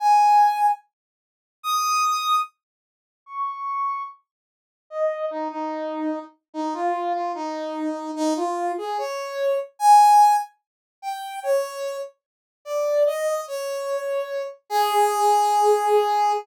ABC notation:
X:1
M:4/4
L:1/8
Q:"Swing 16ths" 1/4=147
K:Dblyd
V:1 name="Brass Section"
a4 z4 | e'4 z4 | d'4 z4 | e2 E E4 z |
E F2 F E4 | E F2 A d3 z | [K:Ablyd] a3 z3 g2 | _d3 z3 =d2 |
e2 _d5 z | A8 |]